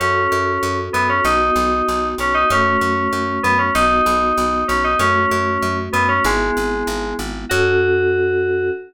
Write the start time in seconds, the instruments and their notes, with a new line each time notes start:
0.00 electric bass (finger) F#2, electric piano 2 C#4, electric piano 1 C#4 F#4 A4
0.32 electric bass (finger) F#2
0.63 electric bass (finger) F#2
0.93 electric bass (finger) F#2, electric piano 2 B3
1.09 electric piano 2 C#4
1.24 electric bass (finger) B1, electric piano 1 B3 D#4 F#4, electric piano 2 D#4
1.56 electric bass (finger) B1
1.88 electric bass (finger) B1
2.18 electric bass (finger) B1, electric piano 2 C#4
2.34 electric piano 2 D#4
2.50 electric bass (finger) F#2, electric piano 1 A3 C#4 F#4, electric piano 2 C#4
2.81 electric bass (finger) F#2
3.13 electric bass (finger) F#2
3.43 electric bass (finger) F#2, electric piano 2 B3
3.58 electric piano 2 C#4
3.75 electric bass (finger) B1, electric piano 1 B3 D#4 F#4, electric piano 2 D#4
4.06 electric bass (finger) B1
4.38 electric bass (finger) B1
4.68 electric bass (finger) B1, electric piano 2 C#4
4.84 electric piano 2 D#4
4.99 electric bass (finger) F#2, electric piano 1 A3 C#4 F#4, electric piano 2 C#4
5.31 electric bass (finger) F#2
5.62 electric bass (finger) F#2
5.93 electric bass (finger) F#2, electric piano 2 B3
6.08 electric piano 2 C#4
6.24 electric bass (finger) G#1, electric piano 1 G#3 B3 E4, electric piano 2 G#3
6.57 electric bass (finger) G#1
6.87 electric bass (finger) G#1
7.19 electric bass (finger) G#1
7.49 electric bass (finger) F#2, electric piano 1 C#4 F#4 A4, electric piano 2 F#4